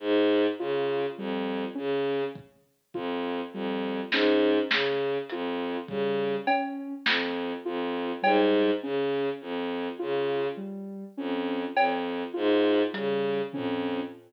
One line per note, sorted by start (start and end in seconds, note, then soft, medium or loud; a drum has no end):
0.00 0.47 G#2 medium
0.59 1.06 C#3 medium
0.59 1.06 F4 medium
1.18 1.65 F2 medium
1.18 1.65 G3 medium
1.75 2.24 C#3 medium
1.75 2.22 C#4 medium
2.35 kick medium
2.94 3.41 F2 medium
2.94 3.41 F4 medium
2.94 kick medium
3.53 4.00 F2 medium
3.53 4.01 G3 medium
4.12 4.59 G#2 medium
4.12 4.60 C#4 medium
4.12 snare loud
4.71 5.18 C#3 medium
4.71 snare loud
5.29 5.77 F2 medium
5.29 5.79 F4 medium
5.29 closed hi-hat medium
5.88 6.35 C#3 medium
5.88 6.38 G3 medium
5.88 kick medium
6.47 6.94 C#4 medium
6.47 cowbell loud
7.06 7.53 F2 medium
7.06 snare loud
7.65 8.12 F2 medium
7.65 8.12 F4 medium
8.22 8.71 G#2 medium
8.22 8.69 G3 medium
8.22 cowbell loud
8.82 9.29 C#3 medium
8.82 9.30 C#4 medium
9.41 9.88 F2 medium
9.99 10.48 C#3 medium
9.99 10.46 F4 medium
10.57 11.04 G3 medium
11.17 11.64 F2 medium
11.17 11.64 C#4 medium
11.76 12.23 F2 medium
11.76 cowbell loud
12.34 12.83 G#2 medium
12.34 12.81 F4 medium
12.93 13.41 C#3 medium
12.93 13.40 G3 medium
12.93 closed hi-hat medium
13.53 14.00 F2 medium
13.53 14.01 C#4 medium
13.53 floor tom medium